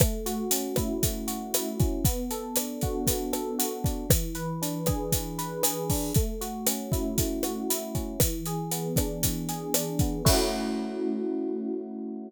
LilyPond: <<
  \new Staff \with { instrumentName = "Electric Piano 1" } { \time 4/4 \key a \major \tempo 4 = 117 a8 fis'8 cis'8 e'8 a8 fis'8 e'8 cis'8 | b8 a'8 d'8 fis'8 b8 a'8 fis'8 d'8 | e8 b'8 d'8 gis'8 e8 b'8 gis'8 d'8 | a8 fis'8 cis'8 e'8 a8 fis'8 e'8 cis'8 |
e8 gis'8 b8 d'8 e8 gis'8 d'8 b8 | <a cis' e' fis'>1 | }
  \new DrumStaff \with { instrumentName = "Drums" } \drummode { \time 4/4 <hh bd ss>8 hh8 hh8 <hh bd ss>8 <hh bd>8 hh8 <hh ss>8 <hh bd>8 | <hh bd>8 hh8 <hh ss>8 <hh bd>8 <hh bd>8 <hh ss>8 hh8 <hh bd>8 | <hh bd ss>8 hh8 hh8 <hh bd ss>8 <hh bd>8 hh8 <hh ss>8 <hho bd>8 | <hh bd>8 hh8 <hh ss>8 <hh bd>8 <hh bd>8 <hh ss>8 hh8 <hh bd>8 |
<hh bd ss>8 hh8 hh8 <hh bd ss>8 <hh bd>8 hh8 <hh ss>8 <hh bd>8 | <cymc bd>4 r4 r4 r4 | }
>>